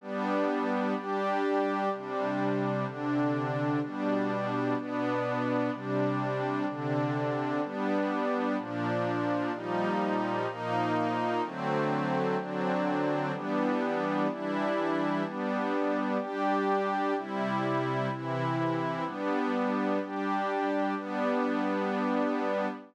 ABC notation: X:1
M:6/8
L:1/8
Q:3/8=63
K:G
V:1 name="Pad 2 (warm)"
[G,B,D]3 [G,DG]3 | [C,G,D]3 [C,D,D]3 | [B,,G,D]3 [B,,B,D]3 | [C,G,D]3 [C,D,D]3 |
[G,B,D]3 [_B,,=F,D]3 | [_B,,=F,G,_E]3 [B,,F,_B,E]3 | [D,F,A,C]3 [D,F,CD]3 | [E,G,B,D]3 [E,G,DE]3 |
[G,B,D]3 [G,DG]3 | [C,G,E]3 [C,E,E]3 | [G,B,D]3 [G,DG]3 | [G,B,D]6 |]